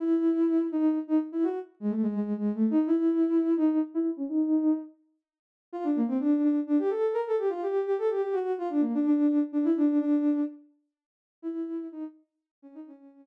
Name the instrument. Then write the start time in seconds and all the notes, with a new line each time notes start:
ocarina
0.00 E4
0.72 D#4
1.07 D#4
1.32 E4
1.43 F#4
1.80 G#3
1.90 A3
2.02 G#3
2.14 G#3
2.37 G#3
2.54 A3
2.70 D#4
2.86 E4
3.56 D#4
3.94 E4
4.17 C#4
4.28 D#4
5.73 F4
5.83 D4
5.95 A#3
6.07 C4
6.19 D4
6.44 D4
6.67 D4
6.79 G4
6.90 A4
7.13 A#4
7.27 A4
7.38 G4
7.49 F4
7.62 G4
7.86 G4
7.98 A4
8.10 G4
8.22 G4
8.33 F#4
8.58 F4
8.69 D4
8.80 A#3
8.94 D4
9.05 D4
9.27 D4
9.52 D4
9.64 E4
9.76 D4
10.00 D4
11.42 E4
11.92 D#4
12.62 C#4
12.74 D#4
12.86 C#4